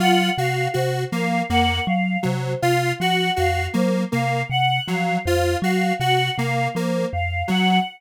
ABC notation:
X:1
M:7/8
L:1/8
Q:1/4=80
K:none
V:1 name="Kalimba" clef=bass
_G, C, C, F, F,, G, C, | C, F, F,, _G, C, C, F, | F,, _G, C, C, F, F,, G, |]
V:2 name="Lead 1 (square)"
F _G G _B, B, z _G, | F _G G _B, B, z _G, | F _G G _B, B, z _G, |]
V:3 name="Choir Aahs"
_g f c f g f c | f _g f c f g f | c f _g f c f g |]